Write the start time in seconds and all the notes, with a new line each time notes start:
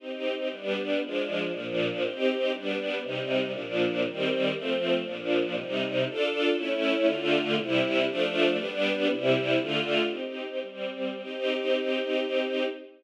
0.00 C4 D#4 G4
0.50 G3 B3 D4
1.01 F3 G#3 D4
1.53 A#2 F3 D4
2.02 C4 D#4 G4
2.52 G3 B3 D4
3.01 C3 G3 D#4
3.53 A#2 F3 D4
4.05 D#3 G3 C4
4.52 F3 A3 C4
5.05 A#2 F3 D4
5.54 C3 G3 D#4
6.06 D4 F4 A4
6.57 A3 C#4 E4
7.06 D3 A3 F4
7.57 C3 G3 E4
8.07 F3 A3 D4
8.57 G3 B3 D4
9.09 C3 G3 E4
9.57 D3 A3 F4
10.07 C4 D#4 G4
10.61 G3 C4 G4
11.23 C4 D#4 G4